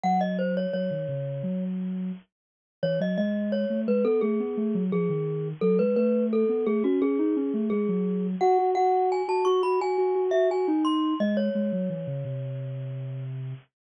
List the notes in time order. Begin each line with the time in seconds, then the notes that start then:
0.03 F#3 F#5
0.21 D#5
0.39 C5
0.57 C#5
0.73 F#3 C#5
0.91 D#3
1.08 C#3
1.43 F#3
2.83 E3 C#5
3.00 F#3 D#5
3.18 G#3 D#5
3.52 C#5
3.70 A3
3.87 G#3 B4
4.05 B3 A4
4.21 A3 G#4
4.40 B3
4.57 A3
4.75 F#3
4.92 F3 G#4
5.09 D#3
5.61 F#3 A4
5.79 G#3 B4
5.96 A3 B4
6.33 A4
6.49 B3
6.66 A3 G#4
6.84 C#4 F#4
7.01 C#4 G#4
7.19 D#4
7.36 C#4
7.54 A3
7.70 G#3 G#4
7.89 F#3
8.41 F#4 F#5
8.58 F#4
8.75 F#4 F#5
9.12 G#5
9.28 F#4 A5
9.45 F#4 C#6
9.63 F#4 B5
9.80 F#4 G#5
9.98 F#4
10.15 F#4
10.31 F#4 E5
10.50 F#4 G#5
10.68 D#4
10.85 C6
11.20 G#3 D#5
11.37 C#5
11.55 G#3
11.72 F#3
11.90 E3
12.07 C#3
12.25 C3